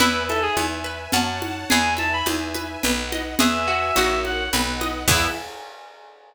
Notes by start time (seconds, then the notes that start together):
0.00 E2 E4 B4 E5 G#5, low conga
0.29 A4 E5, high conga
0.42 G#4
0.57 E2 G#5, high conga
0.84 B4
1.12 F#2 C#5 F#5 A5, low conga
1.42 high conga
1.70 E2 G#4 B4 E5 G#5, low conga
1.97 E5 A5, high conga
2.13 B5
2.26 E2 G#5, high conga
2.54 B4, high conga
2.83 B1 B4 D#5 F#5, low conga
3.12 D#5, high conga
3.39 E2 G#4 B4 E5 G#5, low conga
3.68 F#4
3.95 A#1 F#4 A#4 C#5 F#5, high conga
4.25 F#5, high conga
4.53 B1 B4 D#5 F#5, low conga
4.81 D#5, high conga
5.08 E2 B3 E4 G#4 E5, kick, crash